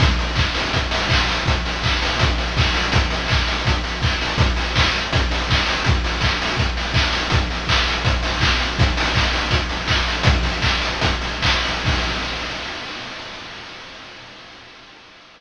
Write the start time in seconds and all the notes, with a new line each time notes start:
0.00 kick, closed hi-hat
0.19 open hi-hat
0.35 kick, clap
0.54 open hi-hat
0.73 kick, closed hi-hat
0.91 open hi-hat
1.09 kick, clap
1.29 open hi-hat
1.46 kick, closed hi-hat
1.65 open hi-hat
1.83 kick, clap
2.02 open hi-hat
2.19 kick, closed hi-hat
2.38 open hi-hat
2.57 kick, clap
2.74 open hi-hat
2.92 kick, closed hi-hat
3.10 open hi-hat
3.28 kick, clap
3.47 open hi-hat
3.65 kick, closed hi-hat
3.84 open hi-hat
4.02 kick, clap
4.21 open hi-hat
4.38 kick, closed hi-hat
4.56 open hi-hat
4.76 kick, clap
4.93 open hi-hat
5.13 kick, closed hi-hat
5.31 open hi-hat
5.50 kick, clap
5.66 open hi-hat
5.84 kick, closed hi-hat
6.04 open hi-hat
6.21 kick, clap
6.42 open hi-hat
6.57 kick, closed hi-hat
6.77 open hi-hat
6.94 kick, clap
7.13 open hi-hat
7.30 kick, closed hi-hat
7.50 open hi-hat
7.67 kick, clap
7.87 open hi-hat
8.05 kick, closed hi-hat
8.23 open hi-hat
8.40 kick, clap
8.59 open hi-hat
8.79 kick, closed hi-hat
8.97 open hi-hat
9.14 kick, clap
9.33 open hi-hat
9.51 kick, closed hi-hat
9.69 open hi-hat
9.88 kick, clap
10.08 open hi-hat
10.23 kick, closed hi-hat
10.43 kick, open hi-hat
10.62 kick, clap
10.81 open hi-hat
11.01 kick, closed hi-hat
11.21 open hi-hat
11.42 kick, clap
11.65 open hi-hat
11.85 kick, crash